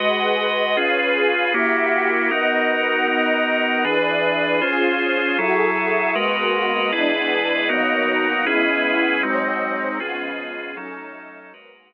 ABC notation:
X:1
M:6/8
L:1/8
Q:3/8=78
K:G#phr
V:1 name="Pad 5 (bowed)"
[GBdf]3 [CGB^e]3 | [^A,=Gef]3 [B,^Adf]3 | [B,^Adf]3 [EGB=d]3 | [C^EG^B]3 [FGA=e]3 |
[G,^A,B,F]3 [E,G,B,=D]3 | [B,,F,^A,D]3 [C,G,B,E]3 | [G,,F,^B,D]3 [C,^E,G,=B,]3 | [F,A,CD]3 [G,,F,^A,B,]3 |]
V:2 name="Drawbar Organ"
[G,FBd]3 [C^EGB]3 | [^A,EF=G]3 [B,DF^A]3 | [B,DF^A]3 [E,=DGB]3 | [C^EG^B]3 [F,=EGA]3 |
[G,F^AB]3 [EGB=d]3 | [B,DF^A]3 [CEGB]3 | [G,^B,DF]3 [C^EG=B]3 | [F,CDA]3 [G,F^AB]3 |]